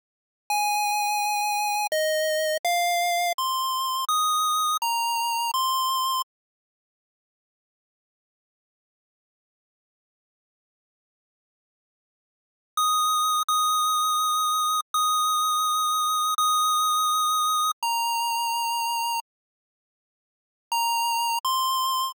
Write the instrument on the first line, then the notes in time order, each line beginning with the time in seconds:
lead 1 (square)
0.50 G#5
1.92 D#5
2.65 F5
3.38 C6
4.09 D#6
4.82 A#5
5.54 C6
12.77 D#6
13.48 D#6
14.94 D#6
16.38 D#6
17.83 A#5
20.72 A#5
21.45 C6